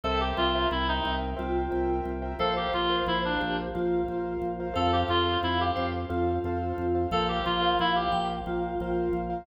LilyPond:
<<
  \new Staff \with { instrumentName = "Clarinet" } { \time 7/8 \key f \major \tempo 4 = 89 a'16 g'16 f'8 e'16 ees'8 r4. r16 | a'16 g'16 f'8 e'16 d'8 r4. r16 | a'16 g'16 f'8 e'16 g'8 r4. r16 | a'16 g'16 f'8 e'16 g'8 r4. r16 | }
  \new Staff \with { instrumentName = "Vibraphone" } { \time 7/8 \key f \major e''4.~ e''16 r16 f'4. | c''4. g'16 r16 f'4. | f''4. c''16 r16 f'4. | f''4. g''16 r16 f'4. | }
  \new Staff \with { instrumentName = "Acoustic Grand Piano" } { \time 7/8 \key f \major <bes' c'' e'' g''>16 <bes' c'' e'' g''>16 <bes' c'' e'' g''>16 <bes' c'' e'' g''>8 <bes' c'' e'' g''>8. <bes' c'' e'' g''>8 <bes' c'' e'' g''>8. <bes' c'' e'' g''>16 | <bes' c'' f''>16 <bes' c'' f''>16 <bes' c'' f''>16 <bes' c'' f''>8 <bes' c'' f''>8. <bes' c'' f''>8 <bes' c'' f''>8. <bes' c'' f''>16 | <a' c'' f''>16 <a' c'' f''>16 <a' c'' f''>16 <a' c'' f''>8 <a' c'' f''>8. <a' c'' f''>8 <a' c'' f''>8. <a' c'' f''>16 | <bes' c'' f''>16 <bes' c'' f''>16 <bes' c'' f''>16 <bes' c'' f''>8 <bes' c'' f''>8. <bes' c'' f''>8 <bes' c'' f''>8. <bes' c'' f''>16 | }
  \new Staff \with { instrumentName = "Drawbar Organ" } { \clef bass \time 7/8 \key f \major c,8 c,8 c,8 c,8 c,8 c,8 c,8 | bes,,8 bes,,8 bes,,8 bes,,8 bes,,8 bes,,8 bes,,8 | f,8 f,8 f,8 f,8 f,8 f,8 f,8 | bes,,8 bes,,8 bes,,8 bes,,8 bes,,8 bes,,8 bes,,8 | }
>>